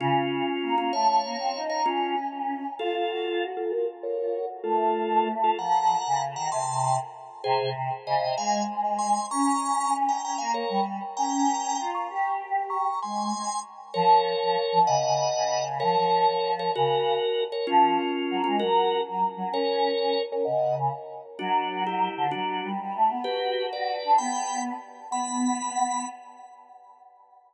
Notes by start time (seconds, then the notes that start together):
0.00 C#3 C#4 F4
0.47 C#4
0.63 A#3
0.77 A#3 C#4 F4
0.93 A3 C#5 F5
1.08 A3
1.23 A#3
1.40 C4
1.55 D#4
1.70 C#5 F5
1.86 C#4 F4
2.79 F4 A4
2.94 F4
3.11 F#4
3.25 F4
3.43 F#4
3.57 F4 A4
3.72 F4 F#4 A#4
4.03 A#4 C#5
4.18 F4
4.34 F#4
4.49 F#4
4.64 A3 F4 A4
5.44 F4 A4
5.57 F3 F#5 A#5
6.06 C#3
6.35 D#3 F#5 A#5
6.52 C3 A5 C6
7.44 C3 G#4 C5
7.59 C3
7.75 C3
8.06 C#3 C5 D#5
8.21 C3
8.37 G#3 F5 G#5
8.98 G#5 C6
9.30 C#4 A#5 C#6
10.08 G5 A#5
10.23 C#4 G5 A#5
10.38 A#3 F5 G#5
10.54 A#4 C#5
10.69 G3
11.17 C#4 G5 A#5
11.79 F4
11.95 A#5 C#6
12.08 G4 A#5 C#6
12.70 A#5 C#6
13.02 G#3 G#5 C6
13.34 G#3
13.94 F3 A#4 C#5
14.43 F3
14.72 F3
14.87 C#3 D#5 F#5
15.05 C#3
15.35 C#3
15.80 F3 A#4 C#5
15.98 F3
16.28 F3
16.59 A#4 C#5
16.75 C#3 F#4 A#4
17.52 A#4 C#5
17.67 F3 C#4 F4
18.31 F#3
18.44 G#3 C#4 F4
18.59 F#3 F#4 A#4
19.08 F#3
19.37 F#3
19.52 C#4 A#4 C#5
19.99 C#4
20.32 C#4 A#4 C#5
20.45 C#3 D#5 F#5
21.39 F#3 D4 F#4
21.87 E4 G4
22.17 D3
22.31 F#3 D4 F#4
22.63 G3
22.80 G3
22.95 A3
23.10 B3
23.24 F#4 G4 B4
23.73 B4 D5
24.04 D4
24.18 B3 G5 B5
25.11 B3 B5